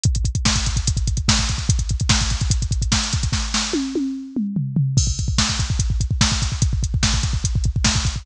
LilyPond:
\new DrumStaff \drummode { \time 4/4 \tempo 4 = 146 <hh bd>16 <hh bd>16 <hh bd>16 <hh bd>16 <bd sn>16 <hh bd>16 <hh bd>16 <hh bd>16 <hh bd>16 <hh bd>16 <hh bd>16 <hh bd>16 <bd sn>16 <hh bd>16 <hh bd>16 <hh bd>16 | <hh bd>16 <hh bd>16 <hh bd>16 <hh bd>16 <bd sn>16 <hh bd>16 <hh bd>16 <hh bd>16 <hh bd>16 <hh bd>16 <hh bd>16 <hh bd>16 <bd sn>16 hh16 <hh bd>16 <hh bd>16 | <bd sn>8 sn8 tommh8 tommh8 r8 toml8 tomfh8 tomfh8 | <cymc bd>16 bd16 <hh bd>16 bd16 <bd sn>16 bd16 <hh bd>16 bd16 <hh bd>16 bd16 <hh bd>16 bd16 <bd sn>16 bd16 <hh bd>16 bd16 |
<hh bd>16 bd16 <hh bd>16 bd16 <bd sn>16 bd16 <hh bd>16 bd16 <hh bd>16 bd16 <hh bd>16 bd16 <bd sn>16 bd16 <hh bd>16 bd16 | }